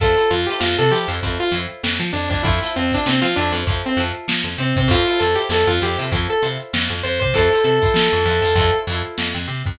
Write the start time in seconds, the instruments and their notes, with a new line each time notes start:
0.00 electric bass (finger) F2, acoustic guitar (steel) E4 F4 A4 C5, lead 2 (sawtooth) A4, kick, closed hi-hat
0.16 acoustic guitar (steel) E4 F4 A4 C5, closed hi-hat
0.30 electric bass (finger) F2, lead 2 (sawtooth) F4, closed hi-hat
0.46 acoustic guitar (steel) E4 F4, lead 2 (sawtooth) G4, snare, closed hi-hat
0.51 acoustic guitar (steel) A4 C5
0.60 electric bass (finger) F2, lead 2 (sawtooth) F4, snare
0.78 electric bass (finger) C3, lead 2 (sawtooth) A4, closed hi-hat
0.91 electric bass (finger) F3, acoustic guitar (steel) E4 F4 A4, lead 2 (sawtooth) G4, closed hi-hat
0.95 acoustic guitar (steel) C5
1.08 electric bass (finger) F2, acoustic guitar (steel) E4 F4 A4 C5, closed hi-hat
1.23 electric bass (finger) F2, acoustic guitar (steel) E4 F4 A4 C5, kick, closed hi-hat
1.40 lead 2 (sawtooth) F4, snare, closed hi-hat
1.52 electric bass (finger) F2, acoustic guitar (steel) E4 F4 A4, closed hi-hat
1.56 acoustic guitar (steel) C5
1.69 closed hi-hat
1.83 electric bass (finger) F2, snare
2.00 electric bass (finger) F3, closed hi-hat
2.13 electric bass (finger) F2, lead 2 (sawtooth) D4, closed hi-hat
2.30 electric bass (finger) F2, lead 2 (sawtooth) D4, kick, closed hi-hat
2.43 electric bass (finger) F2, lead 2 (sawtooth) E4, acoustic guitar (steel) E4 F4 A4, kick, closed hi-hat
2.47 acoustic guitar (steel) C5
2.61 acoustic guitar (steel) E4 F4 A4 C5, snare, closed hi-hat
2.76 electric bass (finger) F2, lead 2 (sawtooth) C4, closed hi-hat
2.92 lead 2 (sawtooth) D4, acoustic guitar (steel) E4 F4 A4 C5, kick, closed hi-hat
3.06 electric bass (finger) C3, lead 2 (sawtooth) C4, snare
3.22 electric bass (finger) F3, lead 2 (sawtooth) F4, snare, closed hi-hat
3.36 electric bass (finger) F2, lead 2 (sawtooth) D4, acoustic guitar (steel) E4 F4 A4 C5, closed hi-hat
3.52 electric bass (finger) F2, acoustic guitar (steel) E4 F4 A4, closed hi-hat
3.57 acoustic guitar (steel) C5
3.67 electric bass (finger) F2, acoustic guitar (steel) E4 F4 A4 C5, kick, closed hi-hat
3.84 lead 2 (sawtooth) C4, closed hi-hat
3.97 electric bass (finger) F2, acoustic guitar (steel) E4 F4 A4, closed hi-hat
4.01 acoustic guitar (steel) C5
4.15 closed hi-hat
4.28 electric bass (finger) F3, snare
4.44 electric bass (finger) F2, closed hi-hat
4.58 electric bass (finger) C3, lead 2 (sawtooth) C4, closed hi-hat
4.76 electric bass (finger) C3, lead 2 (sawtooth) C4, kick, closed hi-hat
4.88 electric bass (finger) F2, acoustic guitar (steel) E4 F4, lead 2 (sawtooth) F4, kick, closed hi-hat
4.93 acoustic guitar (steel) A4 C5
5.07 acoustic guitar (steel) E4 F4 A4 C5, closed hi-hat
5.19 electric bass (finger) F2, lead 2 (sawtooth) A4, closed hi-hat
5.35 acoustic guitar (steel) E4 F4 A4 C5, lead 2 (sawtooth) G4, closed hi-hat
5.49 electric bass (finger) F2, lead 2 (sawtooth) A4, snare
5.67 electric bass (finger) F2, lead 2 (sawtooth) F4, closed hi-hat
5.82 electric bass (finger) F2, acoustic guitar (steel) E4 F4 A4 C5, lead 2 (sawtooth) G4, closed hi-hat
5.98 electric bass (finger) C3, acoustic guitar (steel) E4 F4 A4 C5, snare, closed hi-hat
6.11 electric bass (finger) F2, acoustic guitar (steel) E4 F4 A4 C5, kick, closed hi-hat
6.30 lead 2 (sawtooth) A4, closed hi-hat
6.42 electric bass (finger) C3, acoustic guitar (steel) E4 F4 A4 C5, closed hi-hat
6.60 closed hi-hat
6.73 electric bass (finger) F2, snare
6.90 electric bass (finger) F2, closed hi-hat
7.03 electric bass (finger) F2, lead 2 (sawtooth) C5, closed hi-hat
7.20 electric bass (finger) C3, lead 2 (sawtooth) C5, kick, closed hi-hat
7.34 electric bass (finger) F2, acoustic guitar (steel) E4 F4 A4, lead 2 (sawtooth) A4, kick, closed hi-hat
7.39 acoustic guitar (steel) C5
7.51 acoustic guitar (steel) E4 F4 A4 C5, closed hi-hat
7.64 electric bass (finger) C3, lead 2 (sawtooth) A4, closed hi-hat
7.82 acoustic guitar (steel) E4 F4 A4 C5, kick, closed hi-hat
7.94 electric bass (finger) F3, snare
8.13 electric bass (finger) F2, closed hi-hat
8.25 electric bass (finger) F2, acoustic guitar (steel) E4 F4 A4, snare, closed hi-hat
8.30 acoustic guitar (steel) C5
8.42 electric bass (finger) F2, acoustic guitar (steel) E4 F4 A4, snare, closed hi-hat
8.47 acoustic guitar (steel) C5
8.55 electric bass (finger) F2, acoustic guitar (steel) E4 F4 A4, kick, closed hi-hat
8.60 acoustic guitar (steel) C5
8.74 closed hi-hat
8.87 electric bass (finger) F2, acoustic guitar (steel) E4 F4, closed hi-hat
8.91 acoustic guitar (steel) A4 C5
9.04 closed hi-hat
9.18 electric bass (finger) F2, snare
9.35 electric bass (finger) F2, closed hi-hat
9.48 electric bass (finger) C3, snare, closed hi-hat
9.66 electric bass (finger) F2, kick, closed hi-hat